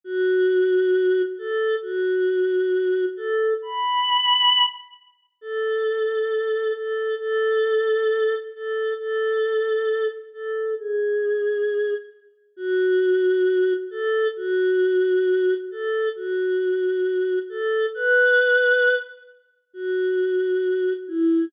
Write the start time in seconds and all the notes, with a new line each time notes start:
0.04 F#4
1.38 A4
1.82 F#4
3.17 A4
3.62 B5
5.41 A4
6.76 A4
7.19 A4
8.54 A4
8.99 A4
10.33 A4
10.79 G#4
12.57 F#4
13.91 A4
14.36 F#4
15.71 A4
16.16 F#4
17.49 A4
17.94 B4
19.74 F#4
21.08 E4